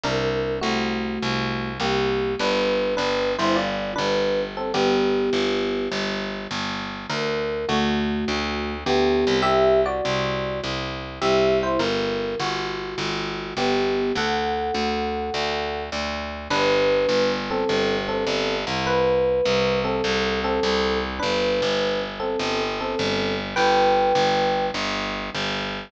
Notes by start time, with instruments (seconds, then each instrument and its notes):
0.04 electric bass (finger) C2, electric piano 1 D4 A#4
0.61 electric bass (finger) C2, electric piano 1 A3 F#4
1.22 electric bass (finger) C2
1.80 electric bass (finger) C2, electric piano 1 A#3 G4
2.39 electric bass (finger) G1, electric piano 1 D4 B4
2.97 electric bass (finger) G1, electric piano 1 D4 B4
3.38 electric bass (finger) G1, electric piano 1 E4 C5
3.56 electric piano 1 F4 D5
3.96 electric bass (finger) G1, electric piano 1 D4 B4
4.57 electric piano 1 C4 A4
4.74 electric bass (finger) G1, electric piano 1 B3 G4
5.33 electric bass (finger) G1
5.92 electric bass (finger) G1
6.51 electric bass (finger) G1
7.10 electric bass (finger) D2, electric piano 1 A#4
7.69 electric bass (finger) D2, electric piano 1 A3 F#4
8.28 electric bass (finger) D2
8.86 electric bass (finger) D2, electric piano 1 B3 G4
9.27 electric bass (finger) C2
9.42 electric piano 1 G4 E5
9.86 electric piano 1 F#4 D5
10.05 electric bass (finger) C2
10.64 electric bass (finger) C2
11.21 electric bass (finger) C2, electric piano 1 G4 E5
11.63 electric piano 1 E4 C5
11.79 electric bass (finger) G1, electric piano 1 A#4
12.39 electric bass (finger) G1, electric piano 1 F#4
12.98 electric bass (finger) G1
13.57 electric bass (finger) G1, electric piano 1 B3 G4
14.15 electric bass (finger) D2, electric piano 1 A4 F#5
14.74 electric bass (finger) D2
15.34 electric bass (finger) D2
15.92 electric bass (finger) D2
16.50 electric bass (finger) G1, electric piano 1 D4 B4
17.09 electric bass (finger) G1
17.51 electric piano 1 C4 A4
17.69 electric bass (finger) G1
18.08 electric piano 1 C4 A4
18.27 electric bass (finger) G1
18.67 electric bass (finger) C2
18.87 electric piano 1 B4
19.45 electric bass (finger) C2
19.84 electric piano 1 C4 A4
20.04 electric bass (finger) C2
20.44 electric piano 1 C4 A4
20.63 electric bass (finger) C2
21.19 electric bass (finger) G1, electric piano 1 D4 B4
21.62 electric bass (finger) G1
22.20 electric piano 1 C4 A4
22.39 electric bass (finger) G1
22.81 electric piano 1 C4 A4
22.99 electric bass (finger) G1
23.56 electric bass (finger) G1, electric piano 1 B4 G5
24.15 electric bass (finger) G1
24.74 electric bass (finger) G1
25.35 electric bass (finger) G1